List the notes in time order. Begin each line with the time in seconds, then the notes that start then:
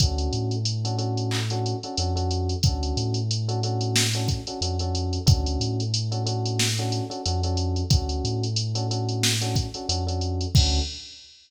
0.00 D2 C#4 D4 F#4 A4, kick, closed hi-hat
0.18 closed hi-hat
0.33 A2, closed hi-hat
0.51 closed hi-hat
0.65 closed hi-hat
0.85 C#4 D4 F#4 A4, closed hi-hat
0.98 C#4 D4 F#4 A4, closed hi-hat
1.17 closed hi-hat
1.31 clap
1.50 C#4 D4 F#4 A4, closed hi-hat
1.66 closed hi-hat
1.83 C#4 D4 F#4 A4, closed hi-hat
1.97 F2 C#4 D4 F#4 A4, closed hi-hat
2.16 C#4 D4 F#4 A4, closed hi-hat
2.31 closed hi-hat
2.49 closed hi-hat
2.63 D2 C#4 D4 F#4 A4, kick, closed hi-hat
2.83 closed hi-hat
2.97 A2, closed hi-hat
3.14 closed hi-hat
3.31 closed hi-hat
3.48 C#4 D4 F#4 A4, closed hi-hat
3.63 C#4 D4 F#4 A4, closed hi-hat
3.81 closed hi-hat
3.96 snare
4.13 C#4 D4 F#4 A4, closed hi-hat
4.28 kick, closed hi-hat
4.47 C#4 D4 F#4 A4, closed hi-hat
4.61 F2 C#4 D4 F#4 A4, closed hi-hat
4.79 C#4 D4 F#4 A4, closed hi-hat
4.95 closed hi-hat
5.13 closed hi-hat
5.26 D2 C#4 D4 F#4 A4, kick, closed hi-hat
5.46 closed hi-hat
5.60 A2, closed hi-hat
5.80 closed hi-hat
5.94 closed hi-hat
6.11 C#4 D4 F#4 A4, closed hi-hat
6.26 C#4 D4 F#4 A4, closed hi-hat
6.45 closed hi-hat
6.59 snare
6.78 C#4 D4 F#4 A4, closed hi-hat
6.92 closed hi-hat
7.10 C#4 D4 F#4 A4, closed hi-hat
7.26 F2 C#4 D4 F#4 A4, closed hi-hat
7.43 C#4 D4 F#4 A4, closed hi-hat
7.57 closed hi-hat
7.76 closed hi-hat
7.90 D2 C#4 D4 F#4 A4, kick, closed hi-hat
8.09 closed hi-hat
8.24 A2, closed hi-hat
8.43 closed hi-hat
8.56 closed hi-hat
8.75 C#4 D4 F#4 A4, closed hi-hat
8.91 C#4 D4 F#4 A4, closed hi-hat
9.09 closed hi-hat
9.23 snare
9.41 C#4 D4 F#4 A4, closed hi-hat
9.56 kick, closed hi-hat
9.74 C#4 D4 F#4 A4, closed hi-hat
9.89 F2 C#4 D4 F#4 A4, closed hi-hat
10.07 C#4 D4 F#4 A4, closed hi-hat
10.21 closed hi-hat
10.41 closed hi-hat
10.55 D2 C#4 D4 F#4 A4, kick, crash